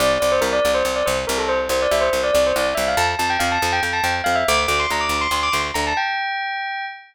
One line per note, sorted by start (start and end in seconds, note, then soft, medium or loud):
0.00 0.18 C2 loud
0.00 0.10 D5 loud
0.20 0.40 C2 medium
0.20 0.30 D5 loud
0.32 0.42 C5 loud
0.41 0.60 C2 medium
0.41 0.51 A#4 loud
0.53 0.71 D5 loud
0.65 0.83 C2 medium
0.74 0.85 C5 loud
0.85 1.03 C2 medium
0.85 0.96 C5 loud
0.96 1.06 D5 loud
1.06 1.25 C2 medium
1.06 1.16 C5 loud
1.27 1.68 C2 loud
1.27 1.37 A#4 loud
1.38 1.48 A4 loud
1.48 1.59 C5 loud
1.69 1.87 C2 loud
1.69 1.80 C5 loud
1.82 1.92 D5 loud
1.91 2.10 C2 medium
1.91 2.01 E5 loud
2.01 2.21 C5 loud
2.13 2.31 C2 medium
2.23 2.33 D5 loud
2.34 2.53 C2 loud
2.34 2.44 D5 loud
2.47 2.57 C5 loud
2.56 2.74 C2 loud
2.56 2.66 D5 loud
2.75 2.95 C2 medium
2.75 2.85 E5 loud
2.88 2.98 F5 loud
2.97 3.15 F2 loud
2.97 3.07 A5 loud
3.19 3.37 F2 medium
3.19 3.29 A5 loud
3.30 3.40 G5 loud
3.39 3.58 F2 loud
3.39 3.49 F5 loud
3.52 3.71 A5 loud
3.62 3.80 F2 loud
3.73 3.83 G5 loud
3.83 4.01 F2 medium
3.83 3.93 G5 medium
3.93 4.03 A5 loud
4.04 4.22 F2 medium
4.04 4.14 G5 loud
4.24 4.44 F2 medium
4.24 4.34 F5 loud
4.35 4.46 E5 loud
4.48 4.66 D2 loud
4.48 4.59 D6 loud
4.68 4.86 D2 medium
4.68 4.78 D6 loud
4.80 4.90 C6 loud
4.90 5.08 D2 medium
4.90 5.02 A#5 loud
5.01 5.20 D6 medium
5.09 5.27 D2 medium
5.21 5.31 C6 loud
5.31 5.49 D2 medium
5.31 5.42 C6 loud
5.43 5.53 D6 loud
5.52 5.71 D2 medium
5.52 5.62 C6 loud
5.74 5.93 D2 medium
5.74 5.84 A#5 loud
5.87 5.97 A5 loud
5.97 6.85 G5 loud